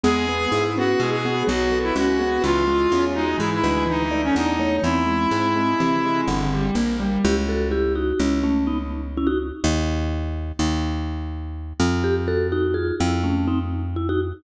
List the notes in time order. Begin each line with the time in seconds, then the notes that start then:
0.04 E2 G#3 B3 G#4
0.27 B3
0.51 G#2 E4
0.76 B3 C#4 F#4
0.98 B2 G#3 E4 G#4
1.10 G#4
1.25 B3 F#4
1.47 B1 F#3 F#4
1.72 B3 A4
1.83 E4
1.96 C#2 C#4 F#4
2.19 B3 G#4
2.42 C#2 E3 E4 F4
2.67 G#3 E4
2.91 E2 C#4 G#4
3.14 G#3 D#4 F#4
3.38 G#2 E3 E4 G#4
3.54 E4
3.63 D2 G#3 B4
3.87 E3 D#4
4.11 A3 D5
4.24 C#4
4.35 E2 D4 D#4 D5
4.59 A3 C#5
4.82 E2 E3 C4 E4
5.06 G#3
5.31 G#2 C4
5.56 G#3
5.79 C3 E3 C4
6.05 G#3
6.27 G1 D3
6.54 G3
6.75 A#1 A#3
7.00 G3
7.24 C#2 E4 G4
7.49 F#4 A4
7.71 E4 G4
7.95 D#4 F#4
8.19 C#2 C#4 E4
8.44 A3 C#4
8.67 B3 D#4
9.17 C#4 E4
9.27 D#4 F#4
9.64 D#2
10.59 D#2
11.80 F2
12.04 G4
12.28 F#4 A4
12.52 D#4 F#4
12.74 F4 G#4
13.00 F2 E4
13.23 A3 C#4
13.47 C4 D#4
13.96 E4
14.09 D#4 F#4